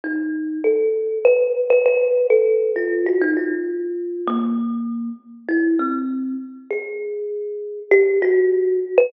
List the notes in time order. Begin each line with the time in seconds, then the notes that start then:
0.04 D#4
0.64 A4
1.25 B4
1.70 B4
1.86 B4
2.30 A4
2.76 F4
3.06 F#4
3.21 D#4
3.37 F4
4.28 A#3
5.49 E4
5.79 C4
6.71 G#4
7.91 G4
8.22 F#4
8.98 B4